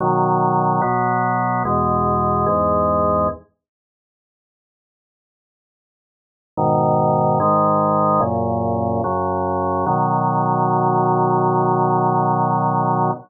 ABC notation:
X:1
M:4/4
L:1/8
Q:1/4=73
K:B
V:1 name="Drawbar Organ"
[B,,D,F,]2 [B,,F,B,]2 [E,,B,,G,]2 [E,,G,,G,]2 | z8 | [G,,B,,D,]2 [G,,D,G,]2 [F,,A,,C,]2 [F,,C,F,]2 | [B,,D,F,]8 |]